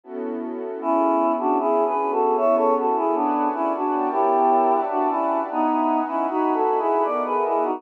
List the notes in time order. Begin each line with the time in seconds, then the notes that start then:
0.04 B3 C#4 E4 F#4 A4
0.81 B3 C#4 E4 G#4
1.39 D4 F#4
1.59 B3 C#4 E4 G#4 B4
1.87 G#4 B4
2.11 F#4 A4
2.37 B3 C#4 E4 G#4 A4 C#5 E5
2.56 A4 C#5
2.78 F#4 A4
2.96 E4 G#4
3.14 B3 D4 B4 D5 F#5 G#5
3.54 C#4 E4
3.75 D4 F#4
3.93 B3 A#4 C#5 G5 A5
4.11 E4 G4
4.71 B4 D5 E5 F#5 A5
4.90 D4 F#4
5.09 C#4 E4
5.49 B3 D#4 B4 D#5 E5 F#5 G#5
6.08 C#4 E4
6.27 D#4 F#4 B4 D#5 F#5 G#5 B5
6.54 F#4 A4
6.79 E4 G#4
7.04 B3 A#4 D5 D#5 E5 F#5
7.25 G#4 B4
7.45 E4 G#4
7.63 D#4 F#4